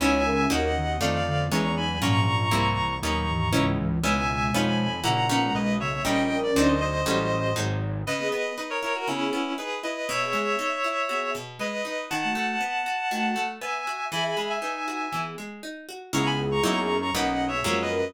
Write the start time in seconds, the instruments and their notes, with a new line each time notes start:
0.00 synth bass 1 C#2, acoustic guitar (steel) B3 C#4 D#4 E4, flute E4 C#5, clarinet E5 G#5
0.25 flute C#4 A#4
0.50 synth bass 1 D#2, acoustic guitar (steel) A#3 C#4 D#4 F#4, clarinet D#5 F#5
0.75 flute D#3 B3
1.01 synth bass 1 F2, flute D#3 C4, acoustic guitar (steel) A3 D4 D#4 F4, clarinet D5 F5
1.26 flute D3 B3
1.51 synth bass 1 E2, flute D#3 B3, acoustic guitar (steel) G#3 B3 C#4 E4, clarinet A#5 C#6
1.77 flute F#3 D#4, clarinet G#5 B5
1.89 flute F#3 D#4
2.01 synth bass 1 A#1, flute G#2 F3, acoustic guitar (steel) F#3 A#3 C#4 F4, clarinet A#5 C#6
2.27 flute G#2 F3
2.51 synth bass 1 C2, acoustic guitar (steel) G3 A#3 C4 E4
2.78 flute F#2 E3
3.02 synth bass 1 D#2, flute A#2 F#3, acoustic guitar (steel) A#3 B3 C#4 D#4, clarinet A#5 C#6
3.28 flute G#2 E3
3.53 synth bass 1 C#2, flute G#2 E3, acoustic guitar (steel) B3 C#4 D#4 E4
3.78 flute G#2 E3
3.90 flute G#2 E3
4.03 synth bass 1 C#2, flute B2 G#3, acoustic guitar (steel) B3 C#4 D#4 E4, clarinet E5 G#5
4.54 synth bass 1 F2, acoustic guitar (steel) B3 C#4 D#4 F4, clarinet G#5 B5
5.03 synth bass 1 A#1, flute C#3 A#3, acoustic guitar (steel) A#3 C#4 E4 F#4, clarinet F#5 A#5
5.29 acoustic guitar (steel) A#3 B3 C#4 D#4
5.42 flute B2 G#3
5.55 synth bass 1 B1, clarinet B4 D#5
5.79 flute C#3 A#3, clarinet C#5 E5
6.05 synth bass 1 A#1, acoustic guitar (steel) G3 A#3 C#4 D#4, flute C#4 A#4, clarinet D#5 G5
6.29 flute C#4 A#4
6.43 clarinet D5
6.55 synth bass 1 D2, acoustic guitar (steel) F#3 C4 D4 D#4, clarinet C5 D#5
6.68 clarinet C5 D#5
6.81 clarinet C5 D#5
7.06 synth bass 1 A1, acoustic guitar (steel) F#3 G3 A3 C#4
7.56 synth bass 1 G#1, acoustic guitar (steel) F#3 G#3 C4 D#4
8.07 acoustic guitar (steel) C#3, clarinet B4 D#5
8.19 flute B3 G#4
8.32 acoustic guitar (steel) B3, clarinet B4 D#5
8.57 acoustic guitar (steel) D#4, clarinet B4 D#5
8.70 clarinet A#4 C#5
8.82 acoustic guitar (steel) E4, clarinet A#4 C#5
8.95 clarinet F#4 A#4
9.07 acoustic guitar (steel) C#3, flute B3 G#4, clarinet C#4 E4
9.33 acoustic guitar (steel) B3
9.58 acoustic guitar (steel) D#4, clarinet G#4 B4
9.83 acoustic guitar (steel) E4, clarinet B4 D#5
10.09 acoustic guitar (steel) B2, clarinet C#5 E5
10.21 flute B3 G#4
10.33 acoustic guitar (steel) G#3
10.59 acoustic guitar (steel) D#4
10.84 acoustic guitar (steel) E4
11.09 flute B3 G#4, acoustic guitar (steel) F#4
11.35 acoustic guitar (steel) B2
11.59 acoustic guitar (steel) G#3, clarinet B4 D#5
11.85 acoustic guitar (steel) D#4
12.10 acoustic guitar (steel) D#3, clarinet F#5 A5
12.24 flute A3 F#4
12.35 acoustic guitar (steel) A3
12.61 acoustic guitar (steel) B3
12.86 acoustic guitar (steel) F#4
13.11 acoustic guitar (steel) D#3, flute A3 F#4
13.36 acoustic guitar (steel) A3
13.61 acoustic guitar (steel) B3, clarinet E5 G#5
13.87 acoustic guitar (steel) F#4
14.12 acoustic guitar (steel) E3, flute G#4 E5, clarinet G#5 B5
14.24 flute G#4 E5, clarinet G#5 B5
14.37 acoustic guitar (steel) G#3, clarinet G#5 B5
14.50 clarinet E5 G#5
14.62 flute D#4 B4, acoustic guitar (steel) D#4
14.88 acoustic guitar (steel) F#4
15.13 acoustic guitar (steel) E3, flute B3 G#4
15.38 acoustic guitar (steel) G#3
15.63 acoustic guitar (steel) D#4
15.89 acoustic guitar (steel) F#4
16.13 synth bass 1 C#2, acoustic guitar (steel) G#3 B3 C#4 E4, flute B3 G#4, clarinet A#5 C#6
16.26 clarinet G#5 B5
16.51 clarinet A#5 C#6
16.63 synth bass 1 F#2, acoustic guitar (steel) F#3 A#3 D#4 E4, clarinet A#5 C#6
16.77 clarinet A#5 C#6
17.02 clarinet A#5 C#6
17.14 synth bass 1 B1, acoustic guitar (steel) F#3 A#3 B3 D#4, flute C#4 A#4, clarinet D#5 F#5
17.48 flute B3 G#4, clarinet C#5 E5
17.64 synth bass 1 F#2, acoustic guitar (steel) F3 F#3 G#3 A#3
17.82 clarinet B4 D#5
17.89 flute C#4 A#4